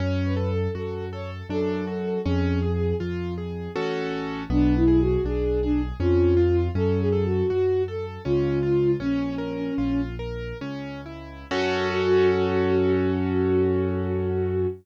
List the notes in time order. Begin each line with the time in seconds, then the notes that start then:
0.00 F#2 C#4 C#5
0.25 B4
0.37 A4
0.50 A4
0.75 F#2 F#4 A4
1.12 A4 C#5
1.49 F#2 D4 A4
1.87 F#4
2.25 F2 C#4 G#4
2.62 G#4
3.00 F2 F4
3.38 G#4
3.76 A1 C#4 F#4 A4
4.50 B1 B3 D4
4.75 E4
4.88 G#4
5.00 F#4
5.25 B1 D4 G#4
5.62 D4 G#4
6.00 F2 C#4 F4
6.37 F4
6.75 F#2 C#4 A4
7.00 G#4
7.12 A4
7.25 F#4
7.50 F#2 F#4
7.88 A4
8.25 C#2 C#4 F4
8.63 F4
9.00 A#1 C#4
9.38 A#4
9.78 A#1 F4
10.19 A#4
10.61 C#2 C#4
11.06 E4
11.51 F#2 C#4 F#4 A4